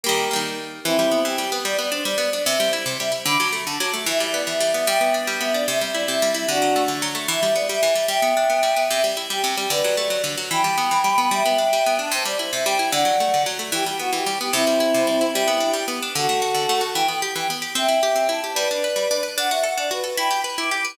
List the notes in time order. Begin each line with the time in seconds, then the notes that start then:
0.04 G3 A#3 G4 A#4
0.09 D#3
0.31 G3 A#3
0.36 D#3
0.84 E3 C4 E4
0.99 G3
1.12 B3
1.25 E3 G4
1.38 G3
1.52 B3
1.65 G3 D5
1.79 B3 D5
1.92 D4 C5
2.05 G3 D5
2.18 B3
2.33 D4 D5
2.45 C3 C5 E5
2.60 G3
2.73 E4
2.85 C3 C5
2.99 G3 E5
3.12 E4
3.26 D3 B5 D6
3.40 F#3
3.53 A3
3.66 D3 A5
3.78 F#3 D6
3.94 A3
4.06 E3 E5
4.18 G3 E5
4.31 B3 D5
4.47 E3 E5
4.60 G3
4.74 B3 E5
4.87 G3 E5 G5
5.01 B3
5.14 D4
5.27 G3
5.40 B3 E5
5.53 D4 D5
5.68 C3 E5
5.79 G3 E5
5.92 E4 D5
6.08 C3 E5
6.22 G3
6.34 E4 E5
6.48 D3 D4 F#4
6.62 F#3
6.76 A3
6.88 D3
7.02 F#3
7.15 A3
7.28 E3 E5
7.43 G3 E5
7.54 B3 D5
7.69 G3 E5
7.83 E3
7.94 G3 E5
8.08 G3 E5 G5
8.22 B3
8.37 D4
8.50 B3
8.63 G3
8.77 B3
8.90 C3 E5
9.04 G3
9.17 E4
9.30 G3 G4
9.44 C3
9.56 G3 G4
9.70 D3 B4 D5
9.84 F#3
9.97 A3 D5
10.10 F#3
10.24 D3
10.38 F#3
10.51 E3 G5 B5
10.64 G3
10.78 B3
10.91 E3
11.04 G3
11.18 B3
11.31 G3 E5 G5
11.46 B3
11.58 D4
11.73 G3
11.86 B3
11.99 D4 A5
12.11 C3 C5
12.25 G3 D5
12.39 E4 C5
12.52 C3 E5
12.65 G3 G5
12.79 E4
12.91 D3 D5 F#5
13.05 F#3
13.20 A3
13.34 D3
13.46 F#3
13.59 A3
13.72 E3 G4
13.85 G3 G4
13.99 B3 F#4
14.13 E3 G4
14.26 G3
14.39 B3 G4
14.53 C3 C4 E4
14.67 G3
14.80 E4
14.94 C3
15.07 G3
15.21 E4
15.33 G3 E4 G4
15.48 B3
15.60 D4
15.73 G3 G4
15.88 B3
16.02 D4
16.15 D3 F#4 A4
16.29 A3
16.42 F#4
16.54 D3
16.69 A3
16.81 F#4
16.94 E3 G5
17.08 B3 G5
17.22 G4
17.36 E3 G5
17.50 B3
17.62 G4
17.75 C4 E5 G5
17.88 E4
18.03 G4
18.16 C4
18.29 E4 A5
18.44 G4
18.54 G3 B4 D5
18.71 D4
18.84 B4
18.96 G3
19.11 D4
19.23 B4
19.38 D4 F#5
19.49 F#4 E5
19.64 A4 F#5
19.77 D4 D5
19.91 F#4 B4
20.04 A4
20.17 E4 G5 B5
20.31 G4
20.44 B4
20.58 E4 D6
20.71 G4 D6
20.85 B4